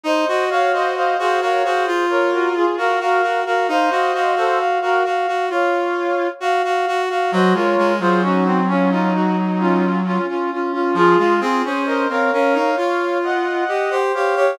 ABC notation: X:1
M:4/4
L:1/16
Q:1/4=66
K:Db
V:1 name="Brass Section"
[ce]2 [df] [ce] [ce] [Ac] [Bd] [Ac]2 [Bd] [GB] [FA] [GB] [GB]2 [GB] | [ce]3 [=Ac] z [GB] z2 [df]4 z4 | [ce] [Bd]2 [Ac] [EG]2 [DF] [DF] [EG] z [DF]2 [DF] [DF] [DF] [DF] | [FA]2 [FA] [Ac] [ce] [df] [df] [df] [df]2 [eg]4 [df]2 |]
V:2 name="Brass Section"
e e f2 f f f2 z4 f f2 f | f f f2 f f f2 z4 f f2 f | G F2 F D C D E5 z4 | F F A2 B B B2 z4 e c2 d |]
V:3 name="Brass Section"
E G G G2 G G G F4 G G G G | E G G G2 G G G F4 G G G G | G, A, A, G,11 z2 | F, A, C D2 C D E F4 =G G G G |]